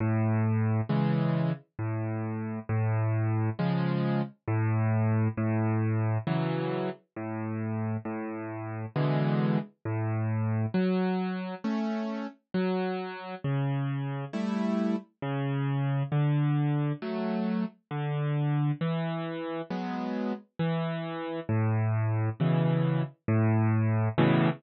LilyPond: \new Staff { \time 3/4 \key a \major \tempo 4 = 67 a,4 <cis e gis>4 a,4 | a,4 <cis eis gis>4 a,4 | a,4 <cis e fis>4 a,4 | a,4 <b, d e gis>4 a,4 |
\key fis \minor fis4 <a cis'>4 fis4 | cis4 <g a e'>4 cis4 | d4 <fis a>4 d4 | e4 <fis gis b>4 e4 |
\key a \major a,4 <b, cis e>4 a,4 | <a, b, cis e>4 r2 | }